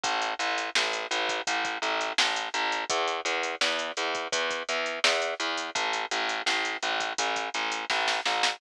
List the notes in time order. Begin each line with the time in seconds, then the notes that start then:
0.03 A1, kick, closed hi-hat
0.22 closed hi-hat
0.39 A1, closed hi-hat
0.58 closed hi-hat
0.75 A1, snare
0.93 closed hi-hat
1.11 A1, closed hi-hat
1.29 kick, closed hi-hat
1.47 A1, kick, closed hi-hat
1.65 kick, closed hi-hat
1.82 A1, closed hi-hat
2.01 closed hi-hat
2.18 A1, snare
2.36 closed hi-hat
2.54 A1, closed hi-hat
2.72 closed hi-hat
2.89 E2, kick, closed hi-hat
3.07 closed hi-hat
3.25 E2, closed hi-hat
3.43 closed hi-hat
3.61 E2, snare
3.79 closed hi-hat
3.97 E2, closed hi-hat
4.15 kick, closed hi-hat
4.32 E2, kick, closed hi-hat
4.50 kick, closed hi-hat
4.69 E2, closed hi-hat
4.86 closed hi-hat
5.04 E2, snare
5.22 closed hi-hat
5.40 E2, closed hi-hat
5.57 closed hi-hat
5.75 A1, kick, closed hi-hat
5.93 closed hi-hat
6.11 A1, closed hi-hat
6.29 closed hi-hat
6.46 A1, snare
6.65 closed hi-hat
6.82 A1, closed hi-hat
7.00 kick, closed hi-hat
7.18 A1, kick, closed hi-hat
7.36 kick, closed hi-hat
7.54 A1, closed hi-hat
7.72 closed hi-hat
7.90 A1, kick, snare
8.08 snare
8.25 A1, snare
8.43 snare